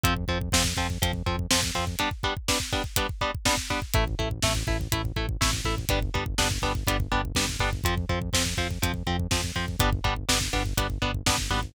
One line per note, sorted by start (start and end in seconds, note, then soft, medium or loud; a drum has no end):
0.03 0.25 F2 medium
0.03 0.14 F3 loud
0.03 0.14 C4 medium
0.03 kick loud
0.03 closed hi-hat loud
0.16 kick medium
0.28 0.50 F2 medium
0.28 0.38 F3 medium
0.28 0.38 C4 medium
0.28 kick medium
0.41 kick loud
0.52 0.74 F2 medium
0.52 0.63 F3 medium
0.52 0.63 C4 medium
0.52 kick loud
0.52 snare loud
0.64 kick medium
0.77 0.98 F2 medium
0.77 0.87 F3 medium
0.77 0.87 C4 medium
0.77 kick medium
0.90 kick medium
1.02 1.23 F2 medium
1.02 1.12 F3 medium
1.02 1.12 C4 medium
1.02 kick loud
1.02 closed hi-hat loud
1.13 kick medium
1.26 1.47 F2 medium
1.26 1.36 F3 medium
1.26 1.36 C4 medium
1.26 kick medium
1.39 kick medium
1.51 1.71 F2 medium
1.51 1.60 F3 medium
1.51 1.60 C4 medium
1.51 kick medium
1.51 snare loud
1.63 kick medium
1.75 1.96 F2 medium
1.75 1.85 F3 medium
1.75 1.85 C4 medium
1.75 kick medium
1.87 kick medium
1.99 2.09 G3 medium
1.99 2.09 B3 medium
1.99 2.09 D4 medium
1.99 kick medium
1.99 closed hi-hat loud
2.11 kick medium
2.23 2.34 G3 medium
2.23 2.34 B3 medium
2.23 2.34 D4 medium
2.23 kick medium
2.37 kick medium
2.48 2.58 G3 medium
2.48 2.58 B3 medium
2.48 2.58 D4 medium
2.48 kick medium
2.48 snare loud
2.60 kick medium
2.72 2.82 G3 medium
2.72 2.82 B3 medium
2.72 2.82 D4 medium
2.72 kick loud
2.84 kick medium
2.96 3.07 G3 medium
2.96 3.07 B3 medium
2.96 3.07 D4 medium
2.96 kick loud
2.96 closed hi-hat loud
3.09 kick medium
3.21 3.31 G3 medium
3.21 3.31 B3 medium
3.21 3.31 D4 medium
3.21 kick medium
3.35 kick medium
3.45 3.55 G3 medium
3.45 3.55 B3 medium
3.45 3.55 D4 medium
3.45 kick medium
3.45 snare loud
3.57 kick medium
3.70 3.80 G3 medium
3.70 3.80 B3 medium
3.70 3.80 D4 medium
3.70 kick medium
3.82 kick medium
3.93 4.15 A1 medium
3.93 4.04 A3 medium
3.93 4.04 E4 medium
3.93 kick loud
3.93 closed hi-hat loud
4.07 kick medium
4.19 4.40 A1 medium
4.19 4.29 A3 medium
4.19 4.29 E4 medium
4.19 kick medium
4.31 kick medium
4.42 4.64 A1 medium
4.42 4.53 A3 medium
4.42 4.53 E4 medium
4.42 kick loud
4.42 snare loud
4.55 kick medium
4.67 4.88 A1 medium
4.67 4.77 A3 medium
4.67 4.77 E4 medium
4.67 kick loud
4.81 kick medium
4.92 5.13 A1 medium
4.92 5.02 A3 medium
4.92 5.02 E4 medium
4.92 kick loud
4.92 closed hi-hat loud
5.05 kick medium
5.16 5.37 A1 medium
5.16 5.26 A3 medium
5.16 5.26 E4 medium
5.16 kick medium
5.29 kick medium
5.41 5.62 A1 medium
5.41 5.51 A3 medium
5.41 5.51 E4 medium
5.41 kick loud
5.41 snare loud
5.53 kick medium
5.65 5.86 A1 medium
5.65 5.75 A3 medium
5.65 5.75 E4 medium
5.65 kick medium
5.78 kick medium
5.89 6.11 G1 medium
5.89 5.99 G3 medium
5.89 5.99 B3 medium
5.89 5.99 D4 medium
5.89 kick loud
5.89 closed hi-hat loud
6.02 kick loud
6.14 6.35 G1 medium
6.14 6.24 G3 medium
6.14 6.24 B3 medium
6.14 6.24 D4 medium
6.14 kick medium
6.26 kick loud
6.38 6.59 G1 medium
6.38 6.48 G3 medium
6.38 6.48 B3 medium
6.38 6.48 D4 medium
6.38 kick loud
6.38 snare loud
6.51 kick medium
6.62 6.84 G1 medium
6.62 6.72 G3 medium
6.62 6.72 B3 medium
6.62 6.72 D4 medium
6.62 kick medium
6.75 kick loud
6.87 7.08 G1 medium
6.87 6.97 G3 medium
6.87 6.97 B3 medium
6.87 6.97 D4 medium
6.87 kick medium
6.87 closed hi-hat loud
7.00 kick loud
7.11 7.32 G1 medium
7.11 7.21 G3 medium
7.11 7.21 B3 medium
7.11 7.21 D4 medium
7.11 kick medium
7.25 kick medium
7.35 7.57 G1 medium
7.35 7.46 G3 medium
7.35 7.46 B3 medium
7.35 7.46 D4 medium
7.35 kick medium
7.35 snare loud
7.49 kick medium
7.59 7.81 G1 medium
7.59 7.70 G3 medium
7.59 7.70 B3 medium
7.59 7.70 D4 medium
7.59 kick medium
7.73 kick medium
7.84 8.06 F2 medium
7.84 7.95 F3 medium
7.84 7.95 C4 medium
7.84 kick loud
7.84 closed hi-hat loud
7.97 kick medium
8.09 8.30 F2 medium
8.09 8.19 F3 medium
8.09 8.19 C4 medium
8.09 kick medium
8.22 kick loud
8.33 8.54 F2 medium
8.33 8.43 F3 medium
8.33 8.43 C4 medium
8.33 kick medium
8.33 snare loud
8.46 kick medium
8.57 8.78 F2 medium
8.57 8.68 F3 medium
8.57 8.68 C4 medium
8.57 kick medium
8.70 kick medium
8.82 9.03 F2 medium
8.82 8.92 F3 medium
8.82 8.92 C4 medium
8.82 kick medium
8.82 closed hi-hat loud
8.94 kick medium
9.07 9.27 F2 medium
9.07 9.16 F3 medium
9.07 9.16 C4 medium
9.07 kick medium
9.19 kick medium
9.31 9.52 F2 medium
9.31 9.41 F3 medium
9.31 9.41 C4 medium
9.31 kick loud
9.31 snare loud
9.43 kick medium
9.55 9.76 F2 medium
9.55 9.65 F3 medium
9.55 9.65 C4 medium
9.55 kick medium
9.68 kick medium
9.79 10.01 G1 medium
9.79 9.90 G3 medium
9.79 9.90 B3 medium
9.79 9.90 D4 medium
9.79 kick loud
9.79 closed hi-hat loud
9.92 kick loud
10.04 10.25 G1 medium
10.04 10.14 G3 medium
10.04 10.14 B3 medium
10.04 10.14 D4 medium
10.04 kick loud
10.16 kick medium
10.29 10.50 G1 medium
10.29 10.38 G3 medium
10.29 10.38 B3 medium
10.29 10.38 D4 medium
10.29 kick medium
10.29 snare loud
10.41 kick medium
10.53 10.74 G1 medium
10.53 10.63 G3 medium
10.53 10.63 B3 medium
10.53 10.63 D4 medium
10.53 kick medium
10.66 kick medium
10.77 10.98 G1 medium
10.77 10.87 G3 medium
10.77 10.87 B3 medium
10.77 10.87 D4 medium
10.77 kick loud
10.77 closed hi-hat loud
10.90 kick medium
11.02 11.23 G1 medium
11.02 11.11 G3 medium
11.02 11.11 B3 medium
11.02 11.11 D4 medium
11.02 kick medium
11.14 kick medium
11.26 11.48 G1 medium
11.26 11.36 G3 medium
11.26 11.36 B3 medium
11.26 11.36 D4 medium
11.26 kick loud
11.26 snare loud
11.38 kick medium
11.50 11.72 G#1 medium
11.50 11.60 G3 medium
11.50 11.60 B3 medium
11.50 11.60 D4 medium
11.50 kick medium
11.63 kick medium